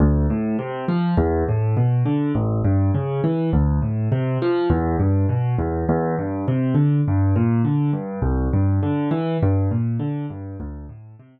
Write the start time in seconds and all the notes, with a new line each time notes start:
0.00 D2
0.30 A2
0.59 C3
0.88 F3
1.17 E2
1.49 A2
1.77 B2
2.06 D3
2.35 A1
2.64 G2
2.94 C#3
3.24 E3
3.53 D2
3.82 A2
4.12 C3
4.42 F3
4.70 E2
5.00 G2
5.29 B2
5.59 E2
5.89 E2
6.19 G2
6.48 C3
6.75 D3
7.08 G2
7.36 A#2
7.65 D3
7.93 G2
8.22 C2
8.53 G2
8.83 D3
9.11 E3
9.43 G2
9.71 A#2
9.99 D3
10.30 G2
10.60 D2
10.89 A2
11.19 C3